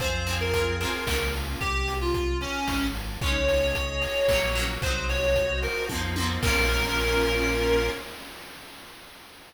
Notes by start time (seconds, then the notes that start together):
0.00 F2 C4 F4 G#4 C5, kick, closed hi-hat
0.04 G#4
0.27 C4 F4, open hi-hat
0.31 G#4
0.40 A#4
0.53 C4 F4, kick, closed hi-hat
0.58 G#4
0.80 C4 F4 A#4, open hi-hat
0.85 G#4
1.07 C#2 A#3 C#4 F4, kick, snare
1.11 F4
1.34 open hi-hat
1.60 C2 G4, kick, closed hi-hat
1.88 open hi-hat
2.01 F4
2.14 kick, closed hi-hat
2.41 C#4, open hi-hat
2.68 G#1, kick, snare
2.95 open hi-hat
3.21 C#2 G#3 C#4 G#4 C#5 D#5, kick, closed hi-hat
3.26 D#4
3.48 open hi-hat
3.75 kick, closed hi-hat
4.02 open hi-hat
4.28 A#1 F#3 A#3 F#4 A#4 C#5, kick, snare
4.33 C#4
4.55 F#3 A#3, open hi-hat
4.59 C#4
4.82 C2 F#3 C4 F#4 C5 D#5, kick, closed hi-hat
4.86 D#4
5.09 C#5, open hi-hat
5.36 kick, closed hi-hat
5.62 A#4, open hi-hat
5.89 F2 F3 A#3 F4 A#4 C5 D#5, kick, high tom
5.94 C4 D#4
6.16 F3 A#3, high tom
6.20 C4 D#4
6.43 A#1 A#3 C#4 F4 A#4, kick, crash
6.47 F4